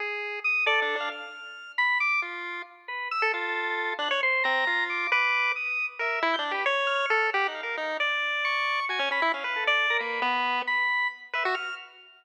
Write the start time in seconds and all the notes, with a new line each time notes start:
0.00 G#4
0.44 D#6
0.66 A4 D5
0.82 D4
0.96 D4
1.00 F5
1.12 F6
1.78 B5
2.00 D6
2.22 F4
2.88 B4
3.11 E6
3.22 A4
3.34 F4 A4
3.99 D4 F#6
4.11 C#5
4.23 C5
4.44 C4 A#5
4.67 F4
4.90 D6
5.12 B4 D6
5.56 D#6
5.99 A#4 E5
6.22 E4
6.34 G6
6.39 D4
6.51 G4 B4
6.66 C#5
6.87 F6
7.10 A4
7.33 G4 F#5
7.48 D#4
7.55 F5
7.63 A#4
7.77 D#4
8.00 D5
8.45 C#6
8.89 F#4 G#5
8.99 C#4
9.11 C#4 B5
9.22 E4
9.34 C#4 F5
9.44 B4
9.56 A4
9.67 D5
9.90 A#4
9.99 A#3 B4
10.22 B3
10.67 B5
11.33 B4 E5
11.45 F#4
11.55 F6